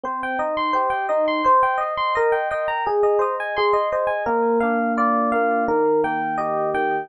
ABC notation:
X:1
M:2/4
L:1/16
Q:1/4=85
K:Bbmix
V:1 name="Electric Piano 1"
c g e c' c g e c' | c g e c' B g e b | A e c a A e c a | B2 f2 d2 f2 |
B2 g2 e2 g2 |]
V:2 name="Electric Piano 1"
C2 E2 G2 E2 | c2 e2 e2 g2 | A2 e2 c'2 e2 | B,2 D2 F2 B,2 |
E,2 B,2 G2 E,2 |]